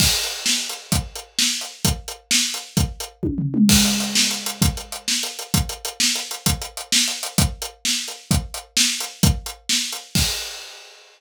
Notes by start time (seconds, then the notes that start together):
0.00 kick, crash
0.23 closed hi-hat
0.46 snare
0.69 closed hi-hat
0.92 kick, closed hi-hat
1.15 closed hi-hat
1.39 snare
1.61 closed hi-hat
1.85 kick, closed hi-hat
2.08 closed hi-hat
2.31 snare
2.54 closed hi-hat
2.77 kick, closed hi-hat
3.00 closed hi-hat
3.23 kick, high tom
3.38 floor tom
3.54 mid tom
3.69 kick, crash
3.85 closed hi-hat
4.00 closed hi-hat
4.15 snare
4.31 closed hi-hat
4.46 closed hi-hat
4.62 kick, closed hi-hat
4.77 closed hi-hat
4.92 closed hi-hat
5.08 snare
5.23 closed hi-hat
5.39 closed hi-hat
5.54 kick, closed hi-hat
5.69 closed hi-hat
5.85 closed hi-hat
6.00 snare
6.15 closed hi-hat
6.31 closed hi-hat
6.46 kick, closed hi-hat
6.62 closed hi-hat
6.77 closed hi-hat
6.92 snare
7.08 closed hi-hat
7.23 closed hi-hat
7.38 kick, closed hi-hat
7.62 closed hi-hat
7.85 snare
8.08 closed hi-hat
8.31 kick, closed hi-hat
8.54 closed hi-hat
8.77 snare
9.00 closed hi-hat
9.23 kick, closed hi-hat
9.46 closed hi-hat
9.69 snare
9.92 closed hi-hat
10.15 kick, crash